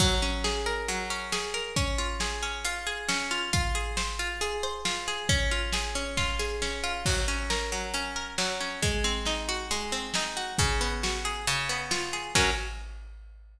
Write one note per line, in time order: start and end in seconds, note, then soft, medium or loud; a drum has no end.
0.00 0.88 F#3 loud
0.00 kick loud
0.00 crash loud
0.22 1.10 C#4 medium
0.44 1.32 G#4 medium
0.44 snare loud
0.66 1.53 A#4 medium
0.88 1.72 F#3 medium
0.88 closed hi-hat loud
1.10 1.73 C#4 medium
1.32 1.74 G#4 medium
1.32 snare loud
1.54 1.75 A#4 medium
1.76 2.42 C#4 loud
1.76 kick loud
1.76 closed hi-hat loud
1.98 2.64 F4 medium
2.20 2.86 G#4 medium
2.20 snare loud
2.43 3.08 C#4 medium
2.65 3.30 F4 medium
2.65 closed hi-hat loud
2.87 3.49 G#4 medium
3.09 3.50 C#4 medium
3.09 snare loud
3.31 3.52 F4 medium
3.53 4.19 F4 loud
3.53 kick loud
3.53 closed hi-hat loud
3.75 4.41 G#4 medium
3.97 4.63 C5 medium
3.97 snare loud
4.19 4.85 F4 medium
4.41 5.07 G#4 medium
4.41 closed hi-hat loud
4.63 5.26 C5 medium
4.85 5.27 F4 medium
4.85 snare loud
5.08 5.29 G#4 medium
5.29 5.95 C#4 loud
5.29 kick loud
5.29 closed hi-hat loud
5.51 6.17 F4 medium
5.73 6.39 G#4 medium
5.73 snare loud
5.95 6.61 C#4 medium
6.17 6.83 F4 loud
6.17 kick loud
6.17 snare medium
6.39 7.02 G#4 medium
6.39 snare medium
6.62 7.04 C#4 medium
6.62 snare medium
6.84 7.05 F4 medium
7.06 7.72 F#3 loud
7.06 kick loud
7.06 crash loud
7.28 7.94 C#4 medium
7.50 8.15 A#4 medium
7.50 snare loud
7.72 8.38 F#3 medium
7.94 8.60 C#4 medium
7.94 closed hi-hat loud
8.16 8.79 A#4 medium
8.38 8.80 F#3 medium
8.38 snare loud
8.60 8.82 C#4 medium
8.82 9.70 G#3 loud
8.82 kick loud
8.82 closed hi-hat loud
9.04 9.92 C4 medium
9.25 10.15 D#4 medium
9.25 snare loud
9.49 10.36 F#4 medium
9.71 10.55 G#3 medium
9.71 closed hi-hat loud
9.92 10.55 C4 medium
10.14 10.57 D#4 medium
10.14 snare loud
10.37 10.58 F#4 medium
10.58 11.43 C#3 loud
10.58 kick loud
10.58 closed hi-hat loud
10.81 11.44 B3 medium
11.03 11.45 F#4 medium
11.03 snare loud
11.25 11.46 G#4 medium
11.47 12.31 C#3 loud
11.47 closed hi-hat loud
11.69 12.32 B3 medium
11.91 12.33 F4 medium
11.91 snare loud
12.13 12.34 G#4 medium
12.35 12.51 F#3 loud
12.35 12.51 C#4 loud
12.35 12.51 A#4 loud
12.35 kick loud
12.35 crash loud